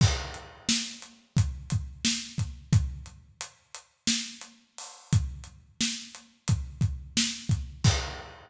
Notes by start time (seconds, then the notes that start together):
0.01 kick, crash
0.34 closed hi-hat
0.69 snare
1.02 closed hi-hat
1.37 kick, closed hi-hat
1.70 kick, closed hi-hat
2.05 snare
2.38 kick, closed hi-hat
2.73 kick, closed hi-hat
3.06 closed hi-hat
3.41 closed hi-hat
3.75 closed hi-hat
4.07 snare
4.41 closed hi-hat
4.78 open hi-hat
5.13 kick, closed hi-hat
5.44 closed hi-hat
5.81 snare
6.15 closed hi-hat
6.48 kick, closed hi-hat
6.81 kick, closed hi-hat
7.17 snare
7.49 kick, closed hi-hat
7.84 kick, crash